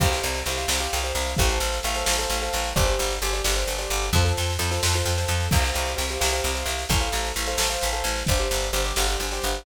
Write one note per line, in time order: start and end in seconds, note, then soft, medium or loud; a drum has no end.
0.00 0.20 C2 medium
0.00 0.09 G4 medium
0.00 0.09 C5 medium
0.00 0.09 F5 medium
0.00 kick loud
0.00 snare medium
0.00 crash medium
0.12 0.39 G4 medium
0.12 0.39 C5 medium
0.12 0.39 F5 medium
0.12 snare medium
0.23 0.43 C2 medium
0.23 snare medium
0.34 snare medium
0.46 0.66 C2 medium
0.46 0.57 G4 medium
0.46 0.57 C5 medium
0.46 0.57 F5 medium
0.46 snare medium
0.57 0.67 G4 medium
0.57 0.67 C5 medium
0.57 0.67 F5 medium
0.57 snare medium
0.68 0.88 C2 medium
0.68 0.78 G4 medium
0.68 0.78 C5 medium
0.68 0.78 F5 medium
0.68 snare loud
0.80 0.99 G4 medium
0.80 0.99 C5 medium
0.80 0.99 F5 medium
0.80 snare medium
0.93 1.13 C2 medium
0.93 snare medium
1.04 1.31 G4 medium
1.04 1.31 C5 medium
1.04 1.31 F5 medium
1.04 snare medium
1.15 1.34 C2 medium
1.15 snare medium
1.27 snare medium
1.36 1.59 A1 loud
1.36 1.47 A4 medium
1.36 1.47 C5 loud
1.36 1.47 F5 medium
1.36 kick medium
1.36 snare medium
1.49 1.78 A4 medium
1.49 1.78 C5 medium
1.49 1.78 F5 medium
1.49 snare medium
1.60 1.80 A1 medium
1.60 snare medium
1.72 snare medium
1.83 2.04 A1 medium
1.83 1.94 A4 medium
1.83 1.94 C5 medium
1.83 1.94 F5 medium
1.83 snare medium
1.95 2.05 A4 medium
1.95 2.05 C5 medium
1.95 2.05 F5 medium
1.95 snare medium
2.05 2.26 A1 medium
2.05 2.15 A4 medium
2.05 2.15 C5 medium
2.05 2.15 F5 medium
2.05 snare loud
2.19 2.37 A4 medium
2.19 2.37 C5 medium
2.19 2.37 F5 medium
2.19 snare medium
2.30 2.49 A1 medium
2.30 snare medium
2.42 2.70 A4 medium
2.42 2.70 C5 medium
2.42 2.70 F5 medium
2.42 snare medium
2.53 2.73 A1 medium
2.53 snare medium
2.64 snare medium
2.76 2.96 G1 medium
2.76 2.85 G4 medium
2.76 2.85 C5 loud
2.76 2.85 D5 medium
2.76 kick medium
2.76 snare medium
2.86 3.14 G4 medium
2.86 3.14 C5 medium
2.86 3.14 D5 medium
2.86 snare medium
2.99 3.19 G1 medium
2.99 snare medium
3.10 snare medium
3.22 3.41 G1 medium
3.22 3.32 G4 medium
3.22 3.32 C5 medium
3.22 3.32 D5 medium
3.22 snare medium
3.33 3.42 G4 medium
3.33 3.42 C5 medium
3.33 3.42 D5 medium
3.33 snare medium
3.44 3.64 G1 medium
3.44 3.54 G4 medium
3.44 3.54 C5 medium
3.44 3.54 D5 medium
3.44 snare loud
3.56 3.74 G4 medium
3.56 3.74 C5 medium
3.56 3.74 D5 medium
3.56 snare medium
3.67 3.87 G1 medium
3.67 snare medium
3.78 4.06 G4 medium
3.78 4.06 C5 medium
3.78 4.06 D5 medium
3.78 snare medium
3.90 4.10 G1 medium
3.90 snare medium
4.02 snare medium
4.13 4.32 F2 loud
4.13 4.24 F4 medium
4.13 4.24 A4 medium
4.13 4.24 C5 loud
4.13 kick medium
4.13 snare medium
4.25 4.52 F4 medium
4.25 4.52 A4 medium
4.25 4.52 C5 medium
4.25 snare medium
4.37 4.57 F2 medium
4.37 snare medium
4.50 snare medium
4.59 4.79 F2 medium
4.59 4.68 F4 medium
4.59 4.68 A4 medium
4.59 4.68 C5 medium
4.59 snare medium
4.71 4.81 F4 medium
4.71 4.81 A4 medium
4.71 4.81 C5 medium
4.71 snare medium
4.83 5.02 F2 medium
4.83 4.93 F4 medium
4.83 4.93 A4 medium
4.83 4.93 C5 medium
4.83 snare loud
4.93 5.14 F4 medium
4.93 5.14 A4 medium
4.93 5.14 C5 medium
4.93 snare medium
5.05 5.25 F2 medium
5.05 snare medium
5.18 5.46 F4 medium
5.18 5.46 A4 medium
5.18 5.46 C5 medium
5.18 snare medium
5.28 5.48 F2 medium
5.28 snare medium
5.40 snare medium
5.51 5.72 C2 medium
5.51 5.62 G4 medium
5.51 5.62 C5 medium
5.51 5.62 F5 medium
5.51 kick loud
5.51 snare medium
5.51 crash medium
5.64 5.91 G4 medium
5.64 5.91 C5 medium
5.64 5.91 F5 medium
5.64 snare medium
5.74 5.95 C2 medium
5.74 snare medium
5.86 snare medium
5.96 6.18 C2 medium
5.96 6.05 G4 medium
5.96 6.05 C5 medium
5.96 6.05 F5 medium
5.96 snare medium
6.09 6.19 G4 medium
6.09 6.19 C5 medium
6.09 6.19 F5 medium
6.09 snare medium
6.20 6.41 C2 medium
6.20 6.30 G4 medium
6.20 6.30 C5 medium
6.20 6.30 F5 medium
6.20 snare loud
6.33 6.51 G4 medium
6.33 6.51 C5 medium
6.33 6.51 F5 medium
6.33 snare medium
6.44 6.64 C2 medium
6.44 snare medium
6.55 6.82 G4 medium
6.55 6.82 C5 medium
6.55 6.82 F5 medium
6.55 snare medium
6.66 6.85 C2 medium
6.66 snare medium
6.79 snare medium
6.89 7.09 A1 loud
6.89 6.99 A4 medium
6.89 6.99 C5 loud
6.89 6.99 F5 medium
6.89 kick medium
6.89 snare medium
7.00 7.28 A4 medium
7.00 7.28 C5 medium
7.00 7.28 F5 medium
7.00 snare medium
7.12 7.32 A1 medium
7.12 snare medium
7.25 snare medium
7.36 7.55 A1 medium
7.36 7.45 A4 medium
7.36 7.45 C5 medium
7.36 7.45 F5 medium
7.36 snare medium
7.46 7.57 A4 medium
7.46 7.57 C5 medium
7.46 7.57 F5 medium
7.46 snare medium
7.58 7.77 A1 medium
7.58 7.68 A4 medium
7.58 7.68 C5 medium
7.58 7.68 F5 medium
7.58 snare loud
7.70 7.88 A4 medium
7.70 7.88 C5 medium
7.70 7.88 F5 medium
7.70 snare medium
7.81 8.02 A1 medium
7.81 snare medium
7.93 8.20 A4 medium
7.93 8.20 C5 medium
7.93 8.20 F5 medium
7.93 snare medium
8.04 8.23 A1 medium
8.04 snare medium
8.16 snare medium
8.26 8.48 G1 medium
8.26 8.38 G4 medium
8.26 8.38 C5 loud
8.26 8.38 D5 medium
8.26 kick medium
8.26 snare medium
8.39 8.67 G4 medium
8.39 8.67 C5 medium
8.39 8.67 D5 medium
8.39 snare medium
8.51 8.70 G1 medium
8.51 snare medium
8.61 snare medium
8.73 8.93 G1 medium
8.73 8.82 G4 medium
8.73 8.82 C5 medium
8.73 8.82 D5 medium
8.73 snare medium
8.84 8.94 G4 medium
8.84 8.94 C5 medium
8.84 8.94 D5 medium
8.84 snare medium
8.96 9.16 G1 medium
8.96 9.06 G4 medium
8.96 9.06 C5 medium
8.96 9.06 D5 medium
8.96 snare loud
9.08 9.26 G4 medium
9.08 9.26 C5 medium
9.08 9.26 D5 medium
9.08 snare medium
9.20 9.39 G1 medium
9.20 snare medium
9.31 9.59 G4 medium
9.31 9.59 C5 medium
9.31 9.59 D5 medium
9.31 snare medium
9.42 9.63 G1 medium
9.42 snare medium
9.54 snare medium